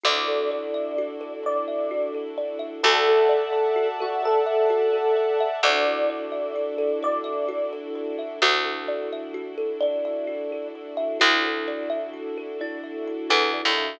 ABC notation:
X:1
M:6/8
L:1/16
Q:3/8=86
K:Dmix
V:1 name="Electric Piano 1"
d12 | d6 z6 | A10 F2 | A12 |
d12 | d6 z6 | z12 | z12 |
z12 | z12 |]
V:2 name="Kalimba"
z12 | z12 | z12 | z12 |
z12 | z12 | F12 | d8 z4 |
E8 z4 | E6 E4 z2 |]
V:3 name="Kalimba"
F2 A2 d2 e2 F2 A2 | d2 e2 F2 A2 d2 e2 | F2 A2 d2 e2 F2 A2 | d2 e2 F2 A2 d2 e2 |
F2 A2 d2 e2 F2 A2 | d2 e2 F2 A2 d2 e2 | F2 A2 d2 e2 F2 A2 | d2 e2 F2 A2 d2 e2 |
F2 A2 d2 e2 F2 A2 | d2 e2 F2 A2 d2 e2 |]
V:4 name="String Ensemble 1"
[DEFA]12- | [DEFA]12 | [defa]12- | [defa]12 |
[DEFA]12- | [DEFA]12 | [DEFA]12- | [DEFA]12 |
[DEFA]12- | [DEFA]12 |]
V:5 name="Electric Bass (finger)" clef=bass
D,,12- | D,,12 | D,,12- | D,,12 |
D,,12- | D,,12 | D,,12- | D,,12 |
D,,12- | D,,6 E,,3 ^D,,3 |]